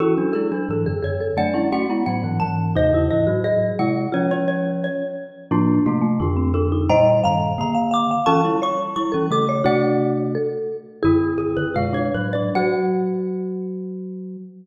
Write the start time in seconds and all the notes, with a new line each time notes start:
0.00 E3 C#4 E4 F#4 A4
0.18 F#3 D4
0.33 G#3 E4 G#4 A4
0.52 F#3 D4
0.69 G#2 E3 A4
0.86 F#2 D3 G#4
1.03 F#2 D3 G#4 C#5
1.20 A4
1.37 F#3 A3 D4 D5 F#5
1.54 G#3 C#4 E4
1.72 A3 C#4 F#4 F#5
1.90 G#3 B3 E4
2.06 A2 F#3 F#5
2.24 G#2 E3
2.40 G#2 E3 A5
2.75 D#2 C3 D#4 C5 D#5
2.93 E2 C#3 E4
3.10 G#2 E3 E4 D#5
3.27 A2 F#3 F#4
3.44 G#4 D#5
3.79 C3 G#3 E4 F#5
4.12 F3 C#4 F4 C#5
4.31 C#4 C#5
4.48 C#5
4.84 C#5
5.51 A2 F3 A#3 D4 F4
5.86 C3 A3 A#3 F4
6.02 A3
6.20 F2 D3 D4 F4
6.37 C4
6.54 D4 A4
6.72 D#4
6.89 A#2 G3 C5 D#5 G5 A#5
7.24 G2 D#3 F5 A#5
7.58 D3 A#3 A#5
7.75 F5
7.91 F5 D6
8.11 F5
8.26 E3 C#4 F4 A4 A5 C#6
8.45 G3 E4
8.62 C#5 C#6
8.96 G3 E4 C#6
9.12 E3 C#4 A4
9.31 C#3 A3 A4 D6
9.49 C#5
9.64 C3 A3 D4 F#4 D5 F#5
10.35 A4
11.03 F#2 D3 E4 G#4
11.38 F#2 D3 G#4
11.57 F#2 D3 B4
11.74 B2 G#3 F4 F5
11.93 D4 C#5
12.14 A2 F#3 B4
12.33 D4 D5
12.55 F#3 F#4 F#5